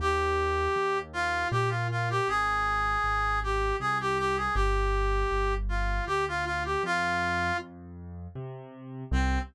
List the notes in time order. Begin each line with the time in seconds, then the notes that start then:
0.00 D#2 G4
0.76 D#2
1.13 F4
1.51 A#2 G4
1.69 F4
1.91 F4
2.10 G4
2.28 G#1 G#4
3.04 G#1
3.43 G4
3.80 C2 G#4
4.00 G4
4.18 G4
4.36 G#4
4.55 G1 G4
5.31 G1
5.69 F4
6.06 D2 G4
6.28 F4
6.45 F4
6.65 G4
6.83 F2 F4
7.59 F2
8.35 C3
9.11 C2 C4